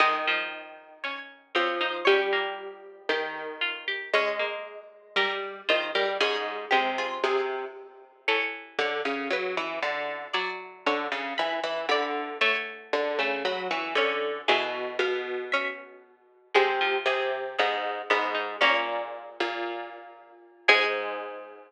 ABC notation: X:1
M:2/2
L:1/8
Q:1/2=58
K:Ab
V:1 name="Harpsichord"
e4 d2 d c | G4 z4 | d4 B2 c B | A3 F A2 z2 |
[K:A] c8 | d4 b b b2 | c4 b c' g2 | e2 =f2 e4 |
[K:Ab] c2 A2 A z _c2 | d5 z3 | A8 |]
V:2 name="Harpsichord"
e8 | d8 | d8 | A2 G A3 z2 |
[K:A] A2 c2 B4 | d2 c4 d2 | e6 c2 | G4 C2 z2 |
[K:Ab] A8 | D6 z2 | A8 |]
V:3 name="Harpsichord"
A, F,3 D2 C E | D B,3 G2 F G | D B,3 G2 F G | D2 A,3 z3 |
[K:A] E,8 | F,8 | A,3 A,3 C2 | E,8 |
[K:Ab] A, F,3 _C2 C E | B,6 z2 | A,8 |]
V:4 name="Harpsichord" clef=bass
E,6 F,2 | G,4 E,4 | A,3 z G,2 E, G, | A,,2 C,2 C,2 z2 |
[K:A] z2 D, C, F, E, D,2 | z2 D, C, E, E, D,2 | z2 D, C, F, E, D,2 | B,,2 B,,6 |
[K:Ab] C,2 C,2 A,,2 A,,2 | B,,3 B,,4 z | A,,8 |]